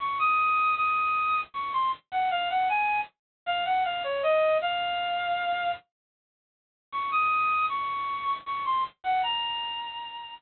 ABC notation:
X:1
M:3/4
L:1/16
Q:1/4=78
K:Bbm
V:1 name="Clarinet"
d' e'3 e'4 d' c' z g | f g a2 z2 f g f d e2 | f6 z6 | d' e'3 d'4 d' c' z g |
b6 z6 |]